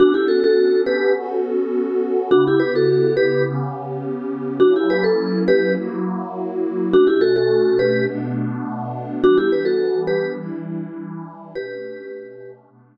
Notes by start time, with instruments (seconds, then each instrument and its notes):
0.00 pad 5 (bowed) B3 C#4 D4 A4, vibraphone D4 F#4
0.14 vibraphone E4 G4
0.28 vibraphone F#4 A4
0.44 vibraphone F#4 A4
0.86 vibraphone G4 B4
1.15 pad 5 (bowed) B3 C#4 F#4 A4
2.31 pad 5 (bowed) C#3 B3 E4 G4, vibraphone D4 F#4
2.47 vibraphone E4 G4
2.60 vibraphone G4 B4
2.75 vibraphone F#4 A4
3.17 vibraphone G4 B4
3.46 pad 5 (bowed) C#3 B3 C#4 G4
4.60 pad 5 (bowed) F#3 A#3 C#4 E4, vibraphone D4 F#4
4.76 vibraphone E4 G4
4.90 vibraphone G4 B4
5.04 vibraphone A4
5.48 vibraphone G4 B4
5.77 pad 5 (bowed) F#3 A#3 E4 F#4
6.92 pad 5 (bowed) B2 A3 C#4 D4, vibraphone D4 F#4
7.07 vibraphone E4 G4
7.21 vibraphone F#4 A4
7.36 vibraphone F#4 A4
7.79 vibraphone G4 B4
8.08 pad 5 (bowed) B2 A3 B3 D4
9.23 pad 5 (bowed) E3 G3 B3 D4, vibraphone D4 F#4
9.38 vibraphone E4 G4
9.52 vibraphone G4 B4
9.65 vibraphone F#4 A4
10.07 vibraphone G4 B4
10.39 pad 5 (bowed) E3 G3 D4 E4
11.54 pad 5 (bowed) B2 A3 C#4 D4, vibraphone G4 B4
12.69 pad 5 (bowed) B2 A3 B3 D4